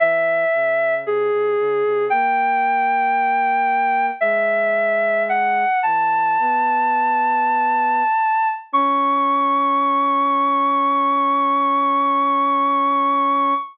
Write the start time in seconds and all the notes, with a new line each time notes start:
0.00 E3 E5
0.53 C#3
1.05 C3 G#4
1.31 C3
1.58 C#3
1.84 C3
2.10 A#3 G5
4.21 G#3 E5
5.29 F#5
5.83 E3 A5
6.39 B3
8.73 C#4 C#6